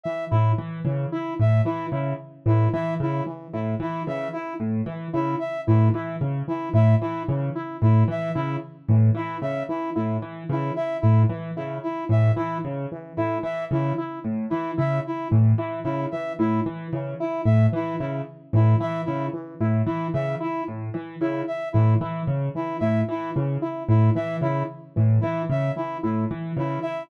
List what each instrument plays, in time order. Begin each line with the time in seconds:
0.04 lead 2 (sawtooth) E3, brass section E5
0.31 acoustic grand piano A2, brass section E4, lead 2 (sawtooth) E4
0.58 acoustic grand piano E3
0.85 acoustic grand piano C#3, lead 2 (sawtooth) E3
1.12 lead 2 (sawtooth) E4, brass section E4
1.40 acoustic grand piano A2, brass section E5
1.65 lead 2 (sawtooth) E3, acoustic grand piano E3, brass section E4
1.92 acoustic grand piano C#3, lead 2 (sawtooth) E4
2.46 acoustic grand piano A2, lead 2 (sawtooth) E3, brass section E4
2.73 acoustic grand piano E3, lead 2 (sawtooth) E4, brass section E5
3.00 acoustic grand piano C#3, brass section E4
3.26 lead 2 (sawtooth) E3
3.53 acoustic grand piano A2, lead 2 (sawtooth) E4
3.80 acoustic grand piano E3, brass section E4
4.07 acoustic grand piano C#3, lead 2 (sawtooth) E3, brass section E5
4.33 brass section E4, lead 2 (sawtooth) E4
4.60 acoustic grand piano A2
4.86 acoustic grand piano E3, lead 2 (sawtooth) E3
5.13 acoustic grand piano C#3, lead 2 (sawtooth) E4, brass section E4
5.40 brass section E5
5.67 acoustic grand piano A2, lead 2 (sawtooth) E3, brass section E4
5.94 acoustic grand piano E3, lead 2 (sawtooth) E4
6.21 acoustic grand piano C#3
6.48 lead 2 (sawtooth) E3, brass section E4
6.74 acoustic grand piano A2, lead 2 (sawtooth) E4, brass section E5
7.01 acoustic grand piano E3, brass section E4
7.28 acoustic grand piano C#3, lead 2 (sawtooth) E3
7.55 lead 2 (sawtooth) E4
7.82 acoustic grand piano A2, brass section E4
8.08 acoustic grand piano E3, lead 2 (sawtooth) E3, brass section E5
8.35 acoustic grand piano C#3, brass section E4, lead 2 (sawtooth) E4
8.89 acoustic grand piano A2, lead 2 (sawtooth) E3
9.15 acoustic grand piano E3, brass section E4, lead 2 (sawtooth) E4
9.42 acoustic grand piano C#3, brass section E5
9.69 lead 2 (sawtooth) E3, brass section E4
9.96 acoustic grand piano A2, lead 2 (sawtooth) E4
10.22 acoustic grand piano E3
10.49 acoustic grand piano C#3, lead 2 (sawtooth) E3, brass section E4
10.76 lead 2 (sawtooth) E4, brass section E5
11.01 acoustic grand piano A2, brass section E4
11.29 acoustic grand piano E3, lead 2 (sawtooth) E3
11.57 acoustic grand piano C#3, lead 2 (sawtooth) E4
11.83 brass section E4
12.09 acoustic grand piano A2, lead 2 (sawtooth) E3, brass section E5
12.36 acoustic grand piano E3, lead 2 (sawtooth) E4, brass section E4
12.65 acoustic grand piano C#3
12.92 lead 2 (sawtooth) E3
13.17 acoustic grand piano A2, brass section E4, lead 2 (sawtooth) E4
13.43 acoustic grand piano E3, brass section E5
13.71 acoustic grand piano C#3, lead 2 (sawtooth) E3, brass section E4
13.98 lead 2 (sawtooth) E4
14.24 acoustic grand piano A2
14.50 acoustic grand piano E3, lead 2 (sawtooth) E3, brass section E4
14.77 acoustic grand piano C#3, lead 2 (sawtooth) E4, brass section E5
15.07 brass section E4
15.31 acoustic grand piano A2, lead 2 (sawtooth) E3
15.58 acoustic grand piano E3, lead 2 (sawtooth) E4
15.84 acoustic grand piano C#3, brass section E4
16.11 lead 2 (sawtooth) E3, brass section E5
16.39 acoustic grand piano A2, brass section E4, lead 2 (sawtooth) E4
16.66 acoustic grand piano E3
16.93 acoustic grand piano C#3, lead 2 (sawtooth) E3
17.20 lead 2 (sawtooth) E4, brass section E4
17.45 acoustic grand piano A2, brass section E5
17.72 lead 2 (sawtooth) E3, acoustic grand piano E3, brass section E4
18.00 acoustic grand piano C#3, lead 2 (sawtooth) E4
18.53 acoustic grand piano A2, lead 2 (sawtooth) E3, brass section E4
18.80 acoustic grand piano E3, lead 2 (sawtooth) E4, brass section E5
19.05 acoustic grand piano C#3, brass section E4
19.33 lead 2 (sawtooth) E3
19.61 acoustic grand piano A2, lead 2 (sawtooth) E4
19.86 acoustic grand piano E3, brass section E4
20.14 acoustic grand piano C#3, lead 2 (sawtooth) E3, brass section E5
20.40 lead 2 (sawtooth) E4, brass section E4
20.68 acoustic grand piano A2
20.94 acoustic grand piano E3, lead 2 (sawtooth) E3
21.21 acoustic grand piano C#3, brass section E4, lead 2 (sawtooth) E4
21.47 brass section E5
21.73 acoustic grand piano A2, lead 2 (sawtooth) E3, brass section E4
22.01 acoustic grand piano E3, lead 2 (sawtooth) E4
22.27 acoustic grand piano C#3
22.55 lead 2 (sawtooth) E3, brass section E4
22.80 acoustic grand piano A2, lead 2 (sawtooth) E4, brass section E5
23.09 acoustic grand piano E3, brass section E4
23.35 acoustic grand piano C#3, lead 2 (sawtooth) E3
23.62 lead 2 (sawtooth) E4
23.89 acoustic grand piano A2, brass section E4
24.15 lead 2 (sawtooth) E3, acoustic grand piano E3, brass section E5
24.42 acoustic grand piano C#3, brass section E4, lead 2 (sawtooth) E4
24.96 acoustic grand piano A2, lead 2 (sawtooth) E3
25.21 acoustic grand piano E3, brass section E4, lead 2 (sawtooth) E4
25.50 acoustic grand piano C#3, brass section E5
25.76 lead 2 (sawtooth) E3, brass section E4
26.03 acoustic grand piano A2, lead 2 (sawtooth) E4
26.31 acoustic grand piano E3
26.57 acoustic grand piano C#3, lead 2 (sawtooth) E3, brass section E4
26.82 lead 2 (sawtooth) E4, brass section E5